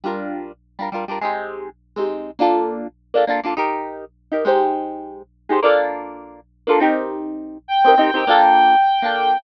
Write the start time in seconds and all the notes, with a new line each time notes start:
0.04 G3 D4 F4 A#4
0.79 G3 D4 F4 A#4
0.92 G3 D4 F4 A#4
1.08 G3 D4 F4 A#4
1.21 G#3 C4 D#4 G4
1.96 G#3 C4 D#4 G4
2.39 A#3 D4 F4 A4
3.14 A#3 D4 F4 A4
3.27 A#3 D4 F4 A4
3.43 A#3 D4 F4 A4
3.56 D#4 G4 A#4
4.31 D#4 G4 A#4
4.45 G#3 D#4 G4 C5
5.49 G#3 D#4 G4 C5
5.62 A#3 D4 F4 A4
6.67 A#3 D4 F4 A4
6.80 C4 D#4 G4 A#4
7.68 G5
7.84 C4 D#4 G4 A#4
7.98 C4 D#4 G4 A#4
8.14 C4 D#4 G4 A#4
8.27 A#3 D4 F4 A4
9.02 A#3 D4 F4 A4